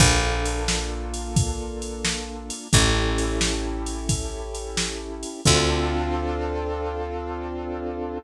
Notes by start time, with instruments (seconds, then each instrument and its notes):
0.00 electric bass (finger) A#1, acoustic grand piano A#3 D4 F4 A4, kick, crash
0.45 ride
0.68 snare
1.14 ride
1.36 kick, ride
1.82 ride
2.05 snare
2.50 ride
2.73 electric bass (finger) A1, acoustic grand piano C#4 E4 G4 A4, kick, ride
3.18 ride
3.41 snare
3.86 ride
4.09 kick, ride
4.55 ride
4.77 snare
5.23 ride
5.45 electric bass (finger) D2, acoustic grand piano C4 D4 F4 A4, kick, crash